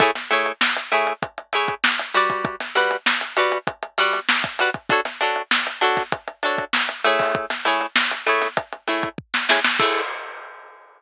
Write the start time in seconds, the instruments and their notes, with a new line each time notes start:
0.00 acoustic guitar (steel) A3 E4 G#4 C#5, kick, closed hi-hat
0.15 snare, closed hi-hat
0.30 acoustic guitar (steel) A3 E4 G#4 C#5, closed hi-hat
0.46 closed hi-hat
0.61 snare
0.77 closed hi-hat
0.92 acoustic guitar (steel) A3 E4 G#4 C#5, closed hi-hat
1.07 closed hi-hat
1.22 kick, closed hi-hat
1.38 closed hi-hat
1.53 acoustic guitar (steel) A3 E4 G#4 C#5, closed hi-hat
1.68 kick, closed hi-hat
1.84 snare
1.99 closed hi-hat
2.14 acoustic guitar (steel) G3 F#4 B4 D5, closed hi-hat
2.30 kick, closed hi-hat
2.45 kick, closed hi-hat
2.60 snare, closed hi-hat
2.75 acoustic guitar (steel) G3 F#4 B4 D5, snare, closed hi-hat
2.91 closed hi-hat
3.06 snare
3.21 closed hi-hat
3.37 acoustic guitar (steel) G3 F#4 B4 D5, closed hi-hat
3.52 closed hi-hat
3.67 kick, closed hi-hat
3.83 closed hi-hat
3.98 acoustic guitar (steel) G3 F#4 B4 D5, closed hi-hat
4.13 snare, closed hi-hat
4.29 snare
4.44 kick, closed hi-hat
4.59 acoustic guitar (steel) G3 F#4 B4 D5, closed hi-hat
4.74 kick, closed hi-hat
4.89 acoustic guitar (steel) D4 F#4 A4 C#5, kick, closed hi-hat
5.05 snare, closed hi-hat
5.21 acoustic guitar (steel) D4 F#4 A4 C#5, closed hi-hat
5.36 closed hi-hat
5.51 snare
5.67 closed hi-hat
5.81 acoustic guitar (steel) D4 F#4 A4 C#5, closed hi-hat
5.97 kick, snare, closed hi-hat
6.12 kick, closed hi-hat
6.28 closed hi-hat
6.43 acoustic guitar (steel) D4 F#4 A4 C#5, closed hi-hat
6.58 kick, closed hi-hat
6.73 snare
6.89 closed hi-hat
7.04 acoustic guitar (steel) A3 E4 G#4 C#5, closed hi-hat
7.19 kick, snare, open hi-hat
7.35 kick, closed hi-hat
7.50 snare, closed hi-hat
7.65 acoustic guitar (steel) A3 E4 G#4 C#5, snare, closed hi-hat
7.81 closed hi-hat
7.96 snare
8.11 closed hi-hat
8.27 acoustic guitar (steel) A3 E4 G#4 C#5, closed hi-hat
8.42 snare, closed hi-hat
8.57 kick, closed hi-hat
8.73 closed hi-hat
8.88 acoustic guitar (steel) A3 E4 G#4 C#5, closed hi-hat
9.03 kick, closed hi-hat
9.18 kick
9.34 snare
9.49 acoustic guitar (steel) A3 E4 G#4 C#5, snare
9.64 snare
9.79 acoustic guitar (steel) A3 E4 G#4 C#5, kick, crash